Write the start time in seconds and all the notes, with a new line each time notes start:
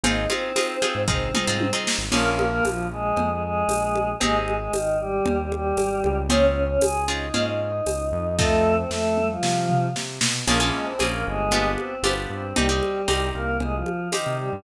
0.03 G#1 C4 D#4 F4 G#4 D#5, cowbell, low conga
0.28 C4 D#4 F4 G#4 C5, high conga
0.56 C4 D#4 F4 G#4, tambourine, cowbell, high conga
0.82 C4 D#4 F4 G#4, high conga
0.95 G#2
1.08 G#1 C4 D#4 F4 G#4 C5, kick, floor tom
1.34 C4 D#4 F4 G#4, mid tom
1.47 G#2 C4 D#4 F4 G#4
1.60 high tom
1.73 C4 D#4 F4 G#4
1.87 snare
1.98 G#1
2.12 A#1 A#3 C#4 F4 G#4 A#4, crash, cowbell, low conga
2.30 A#3 A#4
2.39 high conga
2.48 A#3 A#4
2.64 A#1 F3 F4, tambourine, cowbell, high conga
2.92 G#3 G#4
3.16 F2, cowbell, low conga
3.30 G#3 G#4
3.42 G#3 G#4
3.68 A#1, tambourine, cowbell, high conga
3.95 high conga
4.20 G#1 G#3 C4 D#4 G4 G#4, cowbell, low conga
4.39 G#3 G#4
4.48 high conga
4.56 G#3 G#4
4.73 G#1 D#3 D#4, tambourine, cowbell, high conga
5.00 G3 G4
5.25 D#2, cowbell, low conga
5.39 G3 G4
5.52 G3 G4, high conga
5.77 G#1, tambourine, cowbell, high conga
6.04 C#2, high conga
6.29 C4 C#4 F4 G#4 C#5, cowbell, low conga
6.46 C#4 C#5
6.65 C#4 C#5
6.81 C#2 G#4 G#5, tambourine, cowbell, high conga
7.08 C4 C#4 D#4 F4 G#4 D#5
7.34 G#2 C4 C#4 F4 G#4, cowbell, low conga
7.48 D#4 D#5
7.61 D#4 D#5
7.86 C#2, tambourine, cowbell, high conga
8.12 F2
8.38 A3 C4 D#4 F4 A4, kick, snare
8.77 C4 C5
8.90 F2 A3 A4, snare
9.17 mid tom
9.31 F3 F4
9.42 C3, snare
9.69 floor tom
9.96 C3, snare
10.21 B2, snare
10.46 A#1 A#3 C#4 F4 G#4 A#4, crash, cowbell, low conga
10.60 A#3 C#4 F4 G#4
10.73 G#3 G#4
10.85 C4 C5
10.99 A#1 A#3 C#4 F4 G#4, tambourine, cowbell, high conga
11.12 A#3 A#4
11.26 G1 G#3 G#4
11.51 B3 D4 F4 G4, cowbell, low conga
11.78 C4 C5, high conga
12.03 G1 B3 D4 F4 G4, tambourine, cowbell, high conga
12.30 G2 C4 C5
12.56 C2 G3 C4 D#4 G4, cowbell, low conga
12.69 G3 C4 D#4 G4
12.83 high conga
13.08 C2 C4 D#4 G4, tambourine, cowbell, high conga
13.34 C2 A#3 A#4
13.60 C2 G#3 G#4, cowbell, low conga
13.74 F3 F4
13.86 high conga
14.12 D#3 C4 D#4 G4, tambourine, cowbell, high conga
14.26 C3
14.39 G3 G4
14.53 G2